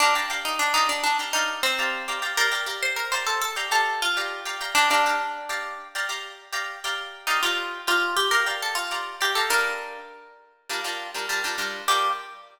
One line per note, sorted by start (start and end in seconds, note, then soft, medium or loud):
0.00 0.14 D4 loud
0.00 0.13 G4 loud
0.00 0.13 D5 loud
0.00 0.13 F5 loud
0.00 0.13 A#5 loud
0.15 0.27 G4 loud
0.15 0.27 D5 loud
0.15 0.27 F5 loud
0.15 0.27 A#5 loud
0.30 0.65 G4 loud
0.30 0.65 D5 loud
0.30 0.65 F5 loud
0.30 0.65 A#5 medium
0.45 0.59 D#4 medium
0.59 0.73 D4 medium
0.74 0.88 D#4 medium
0.74 1.10 G4 loud
0.74 1.10 D5 loud
0.74 1.10 F5 medium
0.74 1.10 A#5 loud
0.89 1.03 D4 medium
1.04 1.18 D4 medium
1.19 1.31 G4 medium
1.19 1.31 D5 medium
1.19 1.31 F5 medium
1.19 1.31 A#5 medium
1.33 1.61 D#4 medium
1.33 1.70 G4 loud
1.33 1.70 D5 loud
1.33 1.70 F5 loud
1.33 1.70 A#5 medium
1.63 2.17 C4 loud
1.79 2.02 G4 medium
1.79 2.02 D5 loud
1.79 2.02 F5 loud
1.79 2.02 A#5 loud
2.08 2.20 G4 loud
2.08 2.20 D5 loud
2.08 2.20 F5 medium
2.08 2.20 A#5 loud
2.22 2.34 G4 loud
2.22 2.34 D5 medium
2.22 2.34 F5 medium
2.22 2.34 A#5 loud
2.37 2.49 G4 loud
2.37 2.51 A#4 loud
2.37 2.49 D5 loud
2.37 2.49 F5 loud
2.37 2.49 A#5 loud
2.52 2.63 G4 loud
2.52 2.63 D5 loud
2.52 2.63 F5 loud
2.52 2.63 A#5 medium
2.66 3.02 G4 loud
2.66 3.02 D5 loud
2.66 3.02 F5 medium
2.66 3.02 A#5 loud
2.83 2.97 C5 medium
2.96 3.11 A#4 medium
3.12 3.48 G4 medium
3.12 3.26 C5 medium
3.12 3.48 D5 loud
3.12 3.48 F5 medium
3.12 3.48 A#5 loud
3.26 3.41 A4 medium
3.42 3.56 A4 medium
3.56 3.68 G4 medium
3.56 3.68 D5 loud
3.56 3.68 F5 loud
3.56 3.68 A#5 medium
3.71 4.07 G4 medium
3.71 4.00 A4 medium
3.71 4.07 D5 loud
3.71 4.07 F5 medium
3.71 4.07 A#5 medium
4.02 4.58 F4 medium
4.17 4.40 G4 loud
4.17 4.40 D5 loud
4.17 4.40 F5 medium
4.17 4.40 A#5 loud
4.45 4.57 G4 loud
4.45 4.57 D5 medium
4.45 4.57 F5 medium
4.45 4.57 A#5 medium
4.61 4.73 G4 loud
4.61 4.73 D5 loud
4.61 4.73 F5 loud
4.61 4.73 A#5 loud
4.75 4.89 D4 loud
4.75 4.87 G4 loud
4.75 4.87 D5 loud
4.75 4.87 F5 loud
4.75 4.87 A#5 loud
4.90 5.78 D4 medium
4.90 5.02 G4 loud
4.90 5.02 D5 loud
4.90 5.02 F5 loud
4.90 5.02 A#5 loud
5.06 5.42 G4 loud
5.06 5.42 D5 loud
5.06 5.42 F5 medium
5.06 5.42 A#5 medium
5.49 5.85 G4 loud
5.49 5.85 D5 loud
5.49 5.85 F5 medium
5.49 5.85 A#5 loud
5.95 6.07 G4 loud
5.95 6.07 D5 loud
5.95 6.07 F5 loud
5.95 6.07 A#5 medium
6.09 6.45 G4 medium
6.09 6.45 D5 loud
6.09 6.45 F5 medium
6.09 6.45 A#5 loud
6.52 6.76 G4 loud
6.52 6.76 D5 loud
6.52 6.76 F5 loud
6.52 6.76 A#5 loud
6.84 7.26 G4 loud
6.84 7.26 D5 loud
6.84 7.26 F5 loud
6.84 7.26 A#5 loud
7.27 7.41 D#4 medium
7.27 7.39 G4 loud
7.27 7.39 D5 medium
7.27 7.39 F5 loud
7.27 7.39 A#5 loud
7.43 7.78 F4 medium
7.43 7.79 G4 loud
7.43 7.79 D5 loud
7.43 7.79 F5 loud
7.43 7.79 A#5 loud
7.87 8.14 F4 medium
7.87 8.23 G4 loud
7.87 8.23 D5 medium
7.87 8.23 F5 loud
7.87 8.23 A#5 loud
8.17 8.31 G4 medium
8.31 8.44 G4 medium
8.31 8.45 A#4 medium
8.31 8.44 D5 medium
8.31 8.44 F5 loud
8.31 8.44 A#5 loud
8.46 8.82 G4 loud
8.46 8.82 D5 medium
8.46 8.82 F5 loud
8.46 8.82 A#5 medium
8.62 8.77 A4 medium
8.75 9.12 F4 medium
8.91 9.15 G4 medium
8.91 9.15 D5 medium
8.91 9.15 F5 medium
8.91 9.15 A#5 loud
9.21 9.36 G4 medium
9.21 9.32 D5 loud
9.21 9.32 F5 loud
9.21 9.32 A#5 loud
9.35 9.48 G4 medium
9.35 9.49 A4 medium
9.35 9.48 D5 medium
9.35 9.48 F5 medium
9.35 9.48 A#5 loud
9.50 9.97 G3 loud
9.50 9.97 D4 loud
9.50 9.97 F4 loud
9.50 10.34 A#4 loud
10.69 10.81 G3 loud
10.69 10.81 D4 loud
10.69 10.81 F4 medium
10.69 10.81 A#4 loud
10.84 11.08 G3 medium
10.84 11.08 D4 loud
10.84 11.08 F4 medium
10.84 11.08 A#4 loud
11.14 11.26 G3 medium
11.14 11.26 D4 medium
11.14 11.26 F4 medium
11.14 11.26 A#4 loud
11.29 11.41 G3 loud
11.29 11.41 D4 loud
11.29 11.41 F4 medium
11.29 11.41 A#4 loud
11.44 11.56 G3 loud
11.44 11.56 D4 loud
11.44 11.56 F4 loud
11.44 11.56 A#4 medium
11.58 11.82 G3 loud
11.58 11.82 D4 loud
11.58 11.82 F4 loud
11.58 11.82 A#4 loud
11.88 12.09 G3 loud
11.88 12.09 D4 loud
11.88 12.09 F4 medium
11.88 12.09 G4 loud
11.88 12.09 A#4 loud